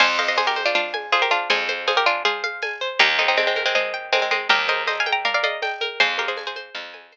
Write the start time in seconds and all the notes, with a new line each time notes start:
0.00 F2 C5 F5 G#5, crash, cowbell, low conga
0.19 C5 D#5 F5, high conga
0.28 C5 D#5
0.36 G#4 C5 G#5, tambourine, cowbell, high conga
0.47 G4 A#4
0.56 C5, high conga
0.66 D4 F4
0.75 D4 F4 F5, cowbell, low conga
0.94 G#5, high conga
1.12 F4 G#4 C5, tambourine, cowbell, high conga
1.22 G4 A#4
1.30 D4 F4 F5, high conga
1.50 F2 G#4 C5 G#5, cowbell, low conga
1.68 C5, high conga
1.87 G#4 C5 F5, tambourine, cowbell, high conga
1.97 G4 A#4
2.06 D4 F4 G#5
2.25 F4 G#4 C5, cowbell, low conga
2.44 F5, high conga
2.62 G#5, tambourine, cowbell, high conga
2.81 C5
2.99 D#2 D#4 G4 A#4, cowbell, low conga
3.19 C4 D#4 D#5, high conga
3.28 C4 D#4
3.37 G#3 C4 G5, tambourine, cowbell, high conga
3.47 G#3 C4
3.56 A#4, high conga
3.66 G#3 C4
3.75 G#3 C4 D#5, cowbell, low conga
3.94 G5
4.12 G#3 C4 A#4, tambourine, cowbell, high conga
4.22 G#3 C4
4.31 G#3 C4 D#5, high conga
4.49 D#2 G4 A#4 G5, cowbell, low conga
4.68 A#4 C5 D#5, high conga
4.87 C5 D#5, tambourine, cowbell, high conga
5.00 F5 G#5
5.06 G5, high conga
5.12 G5 A#5
5.25 A#4 D5 F5, cowbell, low conga
5.34 D5 F5
5.43 D5 D#5 F5, high conga
5.62 G5, tambourine, cowbell, high conga
5.81 A#4, high conga
6.00 F2 G#4 C5, cowbell, low conga
6.18 G4 A#4 F5, high conga
6.28 G#4 C5
6.37 G#5, tambourine, cowbell, high conga
6.47 G#4 C5
6.56 C5, high conga
6.75 F2 F5, cowbell, low conga
6.94 G#5, high conga
7.12 C5, tambourine, cowbell, high conga